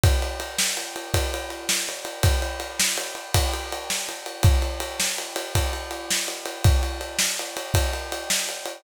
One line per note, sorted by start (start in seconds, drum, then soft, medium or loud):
0.04 kick loud
0.04 ride loud
0.22 ride medium
0.40 ride medium
0.58 snare loud
0.77 ride medium
0.96 ride medium
1.14 kick medium
1.14 ride loud
1.34 ride medium
1.50 ride medium
1.69 snare loud
1.89 ride medium
2.05 ride medium
2.23 kick loud
2.23 ride loud
2.42 ride medium
2.60 ride medium
2.80 snare loud
2.97 ride medium
3.15 ride medium
3.34 kick medium
3.34 ride loud
3.54 ride medium
3.72 ride medium
3.90 snare loud
4.09 ride medium
4.26 ride medium
4.43 kick loud
4.43 ride loud
4.62 ride medium
4.80 ride medium
5.00 snare loud
5.18 ride medium
5.36 ride medium
5.55 kick medium
5.55 ride loud
5.73 ride medium
5.91 ride medium
6.10 snare loud
6.28 ride medium
6.46 ride medium
6.64 kick loud
6.64 ride loud
6.83 ride medium
7.01 ride medium
7.19 snare loud
7.39 ride medium
7.57 ride medium
7.74 kick loud
7.74 ride loud
7.93 ride medium
8.12 ride medium
8.30 snare loud
8.49 ride medium
8.66 ride medium